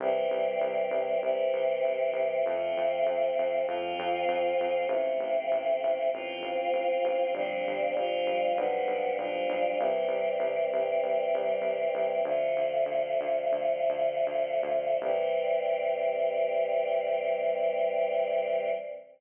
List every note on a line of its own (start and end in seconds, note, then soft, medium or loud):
0.00 0.26 C2 loud
0.00 1.22 E3 medium
0.00 1.22 G3 medium
0.00 1.22 C4 medium
0.31 0.57 C2 medium
0.61 0.87 C2 medium
0.91 1.17 C2 medium
1.22 1.48 C2 medium
1.22 2.44 C3 loud
1.22 2.44 E3 medium
1.22 2.44 C4 medium
1.53 1.79 C2 medium
1.84 2.10 C2 medium
2.13 2.39 C2 medium
2.45 2.72 F2 loud
2.45 3.66 F3 medium
2.45 3.66 A3 medium
2.45 3.66 C4 loud
2.77 3.03 F2 medium
3.06 3.32 F2 medium
3.39 3.65 F2 medium
3.67 3.94 F2 medium
3.67 4.88 F3 loud
3.67 4.88 C4 medium
3.67 4.88 F4 loud
3.99 4.25 F2 medium
4.28 4.54 F2 medium
4.60 4.86 F2 medium
4.88 5.14 A1 loud
4.88 6.11 F3 medium
4.88 6.11 A3 loud
4.88 6.11 C4 medium
5.20 5.46 A1 medium
5.52 5.78 A1 medium
5.83 6.09 A1 medium
6.13 6.39 A1 medium
6.13 7.33 F3 medium
6.13 7.33 C4 loud
6.13 7.34 F4 loud
6.41 6.67 A1 medium
6.73 6.99 A1 medium
7.04 7.30 A1 loud
7.34 7.60 G1 loud
7.34 7.94 F3 loud
7.34 7.94 G3 loud
7.34 7.94 C4 medium
7.34 7.94 D4 loud
7.67 7.93 G1 medium
7.96 8.22 G1 medium
7.96 8.56 F3 loud
7.96 8.56 G3 loud
7.96 8.56 D4 medium
7.96 8.57 F4 loud
8.26 8.52 G1 medium
8.57 8.83 B1 loud
8.57 9.17 F3 medium
8.57 9.17 G3 loud
8.57 9.17 B3 medium
8.57 9.17 D4 medium
8.87 9.13 B1 medium
9.17 9.43 B1 medium
9.17 9.78 F3 loud
9.17 9.78 G3 loud
9.17 9.78 D4 loud
9.17 9.78 F4 medium
9.49 9.75 B1 medium
9.79 10.06 C2 loud
9.79 12.22 E3 loud
9.79 12.22 G3 medium
9.79 12.22 C4 medium
10.08 10.34 C2 medium
10.40 10.66 C2 medium
10.72 10.98 C2 medium
11.02 11.28 C2 medium
11.34 11.60 C2 loud
11.61 11.88 C2 medium
11.95 12.21 C2 medium
12.25 12.51 D2 medium
12.25 14.99 D3 medium
12.25 14.99 F3 loud
12.25 14.99 A3 loud
12.56 12.83 D2 medium
12.86 13.14 D2 medium
13.21 13.50 D2 medium
13.52 13.82 D2 medium
13.89 14.19 D2 medium
14.27 14.59 D2 medium
14.63 14.95 D2 medium
15.01 18.69 C2 loud
15.01 18.70 E3 loud
15.01 18.70 G3 loud
15.01 18.70 C4 medium